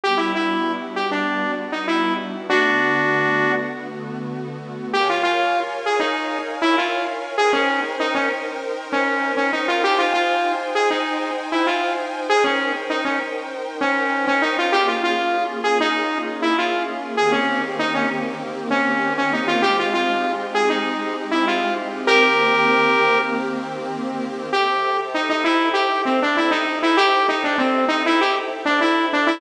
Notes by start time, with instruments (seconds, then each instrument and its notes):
0.04 pad 5 (bowed) G3 B3 D4 F#4, lead 2 (sawtooth) G4
0.17 lead 2 (sawtooth) E4
0.35 lead 2 (sawtooth) E4
0.96 lead 2 (sawtooth) G4
1.11 lead 2 (sawtooth) D4
1.72 lead 2 (sawtooth) D#4
1.88 lead 2 (sawtooth) E4
2.48 pad 5 (bowed) D3 A3 B3 F#4, lead 2 (sawtooth) D4 F#4
4.93 lead 2 (sawtooth) G4, pad 5 (bowed) A#4 C#5 F5 G#5
5.10 lead 2 (sawtooth) F4
5.23 lead 2 (sawtooth) F4
5.86 lead 2 (sawtooth) G#4
6.00 lead 2 (sawtooth) D#4
6.62 lead 2 (sawtooth) E4
6.78 lead 2 (sawtooth) F4
7.38 pad 5 (bowed) D#4 A#4 C5 G5, lead 2 (sawtooth) G#4
7.53 lead 2 (sawtooth) C#4
8.00 lead 2 (sawtooth) D#4
8.15 lead 2 (sawtooth) C#4
8.92 lead 2 (sawtooth) C#4
9.37 lead 2 (sawtooth) C#4
9.53 lead 2 (sawtooth) D#4
9.68 lead 2 (sawtooth) F4
9.84 pad 5 (bowed) D#4 C5 G5 G#5, lead 2 (sawtooth) G4
9.99 lead 2 (sawtooth) F4
10.14 lead 2 (sawtooth) F4
10.75 lead 2 (sawtooth) G#4
10.91 lead 2 (sawtooth) D#4
11.52 lead 2 (sawtooth) E4
11.67 lead 2 (sawtooth) F4
12.29 pad 5 (bowed) D#4 A#4 C5 G5, lead 2 (sawtooth) G#4
12.44 lead 2 (sawtooth) C#4
12.90 lead 2 (sawtooth) D#4
13.05 lead 2 (sawtooth) C#4
13.81 lead 2 (sawtooth) C#4
14.27 lead 2 (sawtooth) C#4
14.42 lead 2 (sawtooth) D#4
14.59 lead 2 (sawtooth) F4
14.72 pad 5 (bowed) A#3 C#4 F4 G#4, lead 2 (sawtooth) G4
14.88 lead 2 (sawtooth) F4
15.04 lead 2 (sawtooth) F4
15.64 lead 2 (sawtooth) G#4
15.80 lead 2 (sawtooth) D#4
16.42 lead 2 (sawtooth) E4
16.58 lead 2 (sawtooth) F4
17.17 pad 5 (bowed) D#3 A#3 C4 G4, lead 2 (sawtooth) G#4
17.32 lead 2 (sawtooth) C#4
17.79 lead 2 (sawtooth) D#4
17.95 lead 2 (sawtooth) C#4
18.71 lead 2 (sawtooth) C#4
19.18 lead 2 (sawtooth) C#4
19.33 lead 2 (sawtooth) D#4
19.48 lead 2 (sawtooth) F4
19.62 pad 5 (bowed) G#3 C4 D#4 G4, lead 2 (sawtooth) G4
19.79 lead 2 (sawtooth) F4
19.94 lead 2 (sawtooth) F4
20.55 lead 2 (sawtooth) G#4
20.70 lead 2 (sawtooth) D#4
21.31 lead 2 (sawtooth) E4
21.48 lead 2 (sawtooth) F4
22.07 pad 5 (bowed) D#3 A#3 C4 G4, lead 2 (sawtooth) G4 A#4
24.53 lead 2 (sawtooth) G4, pad 5 (bowed) A4 C5 E5 G5
25.14 lead 2 (sawtooth) D#4
25.30 lead 2 (sawtooth) D#4
25.44 lead 2 (sawtooth) E4
25.74 lead 2 (sawtooth) G4
26.05 lead 2 (sawtooth) C4
26.22 lead 2 (sawtooth) D4
26.37 lead 2 (sawtooth) E4
26.51 lead 2 (sawtooth) D#4
26.83 lead 2 (sawtooth) E4
26.97 lead 2 (sawtooth) G4
27.29 lead 2 (sawtooth) D#4
27.44 lead 2 (sawtooth) D4
27.58 lead 2 (sawtooth) C4
27.88 lead 2 (sawtooth) D#4
28.06 lead 2 (sawtooth) E4
28.21 lead 2 (sawtooth) G4
28.65 lead 2 (sawtooth) D4
28.81 lead 2 (sawtooth) E4
29.13 lead 2 (sawtooth) D4
29.27 lead 2 (sawtooth) E4